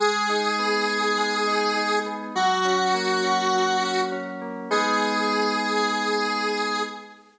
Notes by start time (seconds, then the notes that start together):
0.00 G#3 G#4
0.29 D#4
0.59 B3
0.88 D#4
1.18 G#3
1.47 D#4
1.76 D#4
2.06 B3
2.35 F#3 F#4
2.65 C#4
2.94 A#3
3.24 C#4
3.53 F#3
3.82 C#4
4.12 C#4
4.41 A#3
4.71 G#3 B3 D#4 G#4